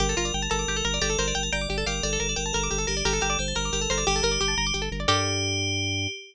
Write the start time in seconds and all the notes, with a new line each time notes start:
0.00 G1 G4 A#4
0.09 A4
0.17 G1 F4 A#4
0.25 D5
0.34 G1 G5
0.42 A5
0.50 G1 A4 A#4 A#5
0.59 D6
0.68 G1 G4
0.76 A4
0.85 G1 A#4
0.94 D5
1.01 G1 G4 A4 D5
1.10 A4
1.18 G1 A#4 C5
1.28 D5
1.35 G1 G5
1.43 A5
1.52 G1 D5 G5 A#5
1.61 D6
1.69 G1 G4 D5
1.78 A4
1.86 G1 G4 A#4 F5
2.03 G1 A4 D5
2.13 A4
2.20 G1 A#4
2.29 D5
2.36 G1 A#4 G5
2.46 A5
2.53 G1 A4 A#4 A#5
2.63 D6
2.71 G1 G4 A4
2.78 A4
2.87 G1 G4 A#4
2.97 D5
3.05 G1 G4 A4 A#4
3.13 A4
3.21 G1 G4 A#4
3.30 D5
3.39 G1 C5 G5
3.48 A5
3.55 G1 A#4 A#5
3.65 D6
3.73 G1 G4 A#4
3.81 A4
3.90 G1 A4 A#4 C5
3.98 D5
4.07 G1 G4
4.16 A4
4.23 G1 A#4
4.31 D5
4.41 G1 G4 G5
4.48 A5
4.57 G1 A#5
4.67 D6
4.74 G1 G4
4.82 A4
4.92 G1 A#4
5.00 D5
5.08 G2 G4 A4 A#4 D5